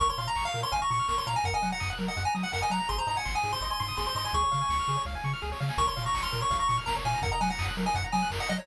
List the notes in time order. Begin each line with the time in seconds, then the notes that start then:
0.00 A#1 A#4 C#6, kick, closed hi-hat
0.09 C#5 C6
0.17 A#2 F5 C6, open hi-hat
0.28 A#5
0.36 A#1 C#6, kick, clap
0.45 F5 F6
0.54 A#2 A#4, open hi-hat
0.63 C#5 C6
0.72 A#1 F5 G#5, kick, closed hi-hat
0.82 A#5 C#6
0.91 A#2 C#6, open hi-hat
0.99 F6
1.08 A#1 A#4 C#6, kick, snare
1.17 C#5 C6
1.27 A#2 F5 A#5, open hi-hat
1.36 G#5 A#5
1.44 F#2 A#4 F#5, kick, closed hi-hat
1.54 D#5 G#5
1.61 F#3 F#5, open hi-hat
1.72 F#5 A#5
1.80 F#2 D#6, kick, clap
1.90 F#6
1.99 F#3 A#4, open hi-hat
2.08 D#5 F#5
2.17 F#2 F#5, kick, closed hi-hat
2.25 G#5 A#5
2.35 F#3 D#6, open hi-hat
2.43 F#5 F#6
2.52 F#2 A#4 F#5, kick, clap
2.62 D#5 G#5
2.70 F#3 F#5 A#5, open hi-hat
2.80 A#5
2.89 G#1 G#4 C6, kick, closed hi-hat
2.98 C5 A#5
3.07 G#2 D#5 A#5, open hi-hat
3.16 F#5 G#5
3.25 G#1 C6, kick, snare
3.35 G#5 D#6
3.43 G#2 G#4, open hi-hat
3.52 C5 C6
3.61 G#1 D#5 C6, kick, closed hi-hat
3.70 G#5 C6
3.80 G#2 C6, open hi-hat
3.88 D#6
3.97 G#1 G#4 C6, kick, snare
4.07 C5 C6
4.15 G#2 D#5 C6, open hi-hat
4.25 G#5 C6
4.33 C#2 G#4 C#6, kick, closed hi-hat
4.43 C#5
4.51 C#3 F5, open hi-hat
4.61 G#5
4.69 C#2 C#6, kick, snare
4.79 F6
4.88 C#3 G#4, open hi-hat
4.97 C#5
5.05 C#2 F5, kick, snare
5.15 G#5
5.24 C#3 C#6, snare
5.33 F6
5.42 C#2 G#4, snare
5.52 C#5, snare
5.60 C#3 F5, snare
5.69 G#5, snare
5.78 A#1 A#4 C#6, kick, closed hi-hat
5.87 C#5 C6
5.97 A#2 F5, open hi-hat
6.06 A#5 C#6
6.14 A#1 C#6, kick, clap
6.23 C6 F6
6.32 A#2 A#4, open hi-hat
6.41 C#5 C#6
6.51 A#1 F5, kick, closed hi-hat
6.59 A#5 C#6
6.68 A#2 C#6, open hi-hat
6.78 F6
6.86 A#1 A#4 A#5, kick, snare
6.96 C#5
7.05 A#2 F5 G#5, open hi-hat
7.14 A#5
7.22 F#2 A#4 F#5, kick, closed hi-hat
7.32 D#5 A#5
7.41 F#3 F#5 G#5, open hi-hat
7.50 F#5 A#5
7.58 F#2 D#6, kick, clap
7.68 F#6
7.77 F#3 A#4, open hi-hat
7.86 D#5 G#5
7.94 F#2 F#5, kick, closed hi-hat
8.04 A#5
8.12 F#3 G#5 D#6, open hi-hat
8.23 F#6
8.30 F#2 A#4, kick, clap
8.40 D#5 F#5
8.49 F#3 D#5 F#5, open hi-hat
8.58 C#5 A#5